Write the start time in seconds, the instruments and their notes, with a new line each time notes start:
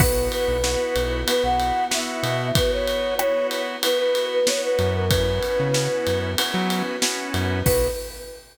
0.00 synth bass 1 B1, drawbar organ B3 E4 F#4, string ensemble 1 B3 E4 F#4, flute B4, kick, crash
0.31 flute B4, ride
0.48 synth bass 1 B1
0.63 drawbar organ B3 E4 F#4, snare
0.96 synth bass 1 B1, ride
1.27 drawbar organ B3 E4 F#4, flute B4, ride
1.43 synth bass 1 B1, flute F#5
1.60 ride
1.91 drawbar organ B3 E4 F#4, flute E5, snare
2.23 synth bass 1 B2, ride
2.55 string ensemble 1 B3 F#4 B4, drawbar organ B3 E4 F#4, flute B4, kick, ride
2.72 flute C#5
2.88 ride
3.19 drawbar organ B3 E4 F#4, flute C#5, cross-stick
3.51 ride
3.83 drawbar organ B3 E4 F#4, flute B4, ride
3.99 flute B4
4.15 ride
4.33 flute B4
4.47 drawbar organ B3 E4 F#4, flute C#5, snare
4.64 flute B4
4.79 synth bass 1 F#2, ride
4.95 flute A#4
5.09 drawbar organ B3 C#4 E4 F#4, string ensemble 1 B3 C#4 E4 F#4, flute B4, kick, ride
5.43 ride
5.59 synth bass 1 C#3
5.74 drawbar organ B3 C#4 E4 F#4, snare
6.07 synth bass 1 F#2, ride
6.38 drawbar organ B3 C#4 E4 F#4, string ensemble 1 B3 C#4 F#4 B4, ride
6.54 synth bass 1 F#3
6.70 ride
7.02 drawbar organ B3 C#4 E4 F#4, snare
7.34 synth bass 1 F#2, ride
7.65 synth bass 1 B1, drawbar organ B3 E4 F#4, string ensemble 1 B3 E4 F#4, flute B4, kick, crash